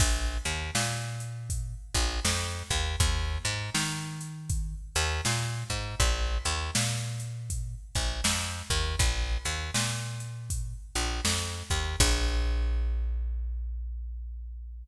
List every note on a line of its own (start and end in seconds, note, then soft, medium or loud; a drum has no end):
0.00 0.38 A#1 medium
0.00 kick loud
0.00 crash loud
0.45 0.71 D#2 medium
0.45 closed hi-hat medium
0.75 1.75 A#2 medium
0.75 snare loud
1.20 closed hi-hat medium
1.50 kick medium
1.50 closed hi-hat loud
1.95 2.20 A#1 medium
1.95 kick medium
1.95 closed hi-hat medium
2.25 2.63 F2 medium
2.25 snare loud
2.70 2.96 D#2 medium
2.70 kick medium
2.70 closed hi-hat medium
3.00 3.38 D#2 medium
3.00 kick loud
3.00 closed hi-hat loud
3.45 3.70 G#2 medium
3.45 closed hi-hat medium
3.75 4.74 D#3 medium
3.75 snare loud
4.21 closed hi-hat medium
4.50 kick medium
4.50 closed hi-hat loud
4.95 5.21 D#2 medium
4.95 closed hi-hat medium
5.25 5.64 A#2 medium
5.25 snare medium
5.70 5.95 G#2 medium
5.70 kick medium
5.70 closed hi-hat medium
6.00 6.38 A#1 medium
6.00 kick medium
6.00 closed hi-hat loud
6.45 6.71 D#2 medium
6.45 closed hi-hat medium
6.75 7.75 A#2 medium
6.75 snare loud
7.20 closed hi-hat medium
7.50 kick medium
7.50 closed hi-hat loud
7.95 8.21 A#1 medium
7.95 kick medium
7.95 closed hi-hat medium
8.24 8.62 F2 medium
8.24 snare loud
8.70 8.96 D#2 medium
8.70 kick medium
8.70 closed hi-hat medium
8.99 9.38 A#1 medium
8.99 kick loud
8.99 closed hi-hat loud
9.45 9.71 D#2 medium
9.45 closed hi-hat medium
9.74 10.74 A#2 medium
9.74 snare loud
10.20 closed hi-hat medium
10.50 kick medium
10.50 closed hi-hat loud
10.95 11.21 A#1 medium
10.95 closed hi-hat medium
11.25 11.63 F2 medium
11.25 snare loud
11.70 11.96 D#2 medium
11.70 kick medium
11.70 closed hi-hat medium
12.00 14.84 A#1 loud
12.00 kick loud
12.00 crash loud